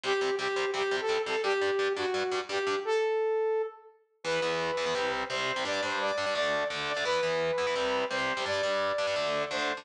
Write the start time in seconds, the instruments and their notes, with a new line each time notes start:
0.03 overdriven guitar C3 G3 C4, lead 2 (sawtooth) G4
0.21 overdriven guitar C3 G3 C4
0.39 overdriven guitar C3 G3 C4, lead 2 (sawtooth) G4
0.56 overdriven guitar C3 G3 C4
0.74 overdriven guitar C3 G3 C4, lead 2 (sawtooth) G4
0.91 overdriven guitar C3 G3 C4
1.00 lead 2 (sawtooth) A4
1.09 overdriven guitar C3 G3 C4
1.26 overdriven guitar C3 G3 C4, lead 2 (sawtooth) A4
1.43 overdriven guitar G2 G3 D4, lead 2 (sawtooth) G4
1.61 overdriven guitar G2 G3 D4
1.79 overdriven guitar G2 G3 D4
1.96 overdriven guitar G2 G3 D4, lead 2 (sawtooth) F#4
2.14 overdriven guitar G2 G3 D4
2.32 overdriven guitar G2 G3 D4
2.49 overdriven guitar G2 G3 D4, lead 2 (sawtooth) G4
2.67 overdriven guitar G2 G3 D4
2.85 lead 2 (sawtooth) A4
4.24 overdriven guitar E2 E3 B3, lead 2 (sawtooth) B4
4.42 overdriven guitar E2 E3 B3
4.77 overdriven guitar E2 E3 B3
4.86 overdriven guitar E2 E3 B3
4.95 overdriven guitar C3 G3 C4
5.30 overdriven guitar C3 G3 C4, lead 2 (sawtooth) C5
5.56 overdriven guitar C3 G3 C4
5.65 overdriven guitar G2 G3 D4, lead 2 (sawtooth) D5
5.82 overdriven guitar G2 G3 D4, lead 2 (sawtooth) C5
6.01 lead 2 (sawtooth) D5
6.18 overdriven guitar G2 G3 D4
6.26 overdriven guitar G2 G3 D4
6.35 overdriven guitar D3 A3 D4, lead 2 (sawtooth) D5
6.70 overdriven guitar D3 A3 D4
6.88 lead 2 (sawtooth) D5
6.96 overdriven guitar D3 A3 D4
7.05 overdriven guitar E3 B3 E4, lead 2 (sawtooth) B4
7.23 overdriven guitar E3 B3 E4
7.58 overdriven guitar E3 B3 E4
7.67 overdriven guitar E3 B3 E4
7.76 overdriven guitar C3 G3 C4
8.11 overdriven guitar C3 G3 C4, lead 2 (sawtooth) C5
8.37 overdriven guitar C3 G3 C4
8.46 overdriven guitar G2 G3 D4, lead 2 (sawtooth) D5
8.63 overdriven guitar G2 G3 D4
8.98 overdriven guitar G2 G3 D4
9.07 overdriven guitar G2 G3 D4
9.16 overdriven guitar D3 A3 D4
9.51 overdriven guitar D3 A3 D4, lead 2 (sawtooth) C5
9.77 overdriven guitar D3 A3 D4